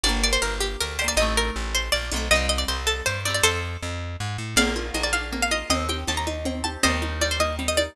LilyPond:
<<
  \new Staff \with { instrumentName = "Pizzicato Strings" } { \time 3/4 \key g \minor \tempo 4 = 159 d''8 d''16 c''16 bes'8 g'8 bes'8 c''16 d''16 | ees''8 bes'8 r8 c''8 d''4 | ees''8 ees''16 d''16 c''8 a'8 c''8 d''16 d''16 | <a' c''>4. r4. |
\key bes \major <d'' f''>4 ees''16 d''16 f''8 r16 f''16 ees''8 | ees''8 g''8 a''16 bes''8. r8 a''8 | <c'' ees''>4 d''16 c''16 ees''8 r16 ees''16 d''8 | }
  \new Staff \with { instrumentName = "Pizzicato Strings" } { \time 3/4 \key g \minor <bes d' g'>2~ <bes d' g'>8 <bes d' g'>8 | <a c' ees'>2~ <a c' ees'>8 <a c' ees'>8 | <g c' ees'>2~ <g c' ees'>8 <g c' ees'>8 | r2. |
\key bes \major bes8 f'8 bes8 d'8 bes8 f'8 | c'8 g'8 c'8 ees'8 c'8 g'8 | g8 ees'8 g8 bes8 g8 ees'8 | }
  \new Staff \with { instrumentName = "Electric Bass (finger)" } { \clef bass \time 3/4 \key g \minor g,,4 g,,4 d,4 | a,,4 a,,4 bes,,8 b,,8 | c,4 c,4 g,4 | f,4 f,4 aes,8 a,8 |
\key bes \major bes,,4 bes,,2 | ees,4 ees,2 | ees,2. | }
  \new DrumStaff \with { instrumentName = "Drums" } \drummode { \time 3/4 r4 r4 r4 | r4 r4 r4 | r4 r4 r4 | r4 r4 r4 |
<cgl cb cymc>8 cgho8 <cgho cb>8 cgho8 <cgl cb>8 cgho8 | <cgl cb>8 cgho8 <cgho cb>8 cgho8 <cgl cb>8 cgho8 | <cgl cb>8 cgho8 <cgho cb>8 cgho8 <cgl cb>8 cgho8 | }
>>